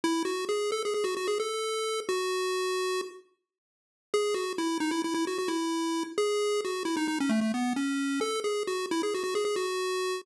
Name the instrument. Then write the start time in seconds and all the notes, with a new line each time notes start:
lead 1 (square)
0.04 E4
0.25 F#4
0.49 G#4
0.72 A4
0.85 G#4
0.94 G#4
1.04 F#4
1.17 F#4
1.28 G#4
1.40 A4
2.09 F#4
4.14 G#4
4.34 F#4
4.58 E4
4.80 D#4
4.91 E4
5.04 E4
5.14 E4
5.27 F#4
5.38 F#4
5.48 E4
6.18 G#4
6.65 F#4
6.85 E4
6.97 D#4
7.08 D#4
7.20 C#4
7.29 A3
7.41 A3
7.54 B3
7.76 C#4
8.21 A4
8.44 G#4
8.67 F#4
8.91 E4
9.03 G#4
9.14 F#4
9.24 F#4
9.35 G#4
9.45 G#4
9.56 F#4